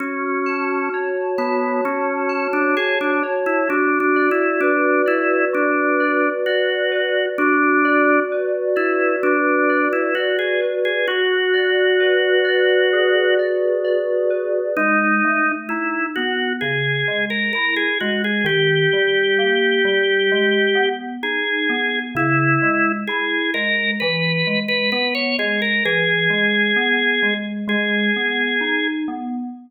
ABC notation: X:1
M:4/4
L:1/16
Q:1/4=65
K:F#m
V:1 name="Drawbar Organ"
C4 z2 B,2 C3 D G D z E | (3D2 D2 E2 D2 E2 D4 F4 | D4 z2 E2 D3 E F G z G | F12 z4 |
[K:G#m] D4 E2 F2 G3 A A G F G | =G12 ^G4 | E4 G2 A2 B3 B B c G A | G8 G6 z2 |]
V:2 name="Electric Piano 2"
F2 a2 c2 a2 F2 a2 a2 c2 | F2 d2 B2 d2 F2 d2 d2 B2 | F2 d2 B2 d2 F2 d2 d2 B2 | F2 d2 B2 d2 G2 d2 d2 B2 |
[K:G#m] G,2 =A,2 D2 B,2 C,2 G,2 E2 G,2 | D,2 =G,2 A,2 G,2 ^G,2 B,2 D2 B,2 | C,2 G,2 E2 G,2 E,2 G,2 B,2 G,2 | E,2 G,2 B,2 G,2 G,2 B,2 D2 B,2 |]